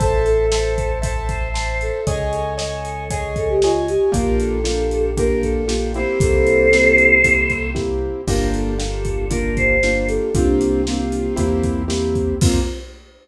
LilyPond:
<<
  \new Staff \with { instrumentName = "Choir Aahs" } { \time 4/4 \key f \major \tempo 4 = 116 a'8 a'4. a'8 c''4 a'8 | aes'8 a'4 a'8 aes'8 a'16 g'16 f'8 g'8 | bes'8 a'4. bes'8 a'4 c''8 | <a' c''>2. r4 |
bes'8 a'4. bes'8 c''4 a'8 | <d' f'>2~ <d' f'>8 r4. | f'4 r2. | }
  \new Staff \with { instrumentName = "Acoustic Grand Piano" } { \time 4/4 \key f \major <c'' e'' a''>4 <c'' e'' a''>4 <c'' e'' a''>4 <c'' e'' a''>4 | <des'' ees'' aes''>4 <des'' ees'' aes''>4 <des'' ees'' aes''>4 <des'' ees'' aes''>4 | <bes d' f' g'>4 <bes d' f' g'>4 <bes d' f' g'>4 <bes d' f' g'>8 <bes c' e' g'>8~ | <bes c' e' g'>4 <bes c' e' g'>4 <bes c' e' g'>4 <bes c' e' g'>4 |
<bes d' f' g'>4 <bes d' f' g'>4 <bes d' f' g'>4 <bes d' f' g'>4 | <bes c' f' g'>4 <bes c' f' g'>4 <bes c' e' g'>4 <bes c' e' g'>4 | <bes c' f'>4 r2. | }
  \new Staff \with { instrumentName = "Synth Bass 1" } { \clef bass \time 4/4 \key f \major a,,1 | des,1 | bes,,1 | c,1 |
g,,1 | c,2 e,2 | f,4 r2. | }
  \new DrumStaff \with { instrumentName = "Drums" } \drummode { \time 4/4 <hh bd>8 hh8 sn8 <hh bd>8 <hh bd>8 <hh bd>8 sn8 hh8 | <hh bd>8 hh8 sn8 hh8 <hh bd>8 <hh bd>8 sn8 hh8 | <hh bd>8 hh8 sn8 hh8 <hh bd>8 <hh bd>8 sn8 hh8 | <hh bd>8 hh8 sn8 hh8 <hh bd>8 <hh bd>8 <bd sn>4 |
<cymc bd>8 hh8 sn8 <hh bd>8 <hh bd>8 <hh bd>8 sn8 hh8 | <hh bd>8 hh8 sn8 hh8 <hh bd>8 <hh bd>8 sn8 <hh bd>8 | <cymc bd>4 r4 r4 r4 | }
>>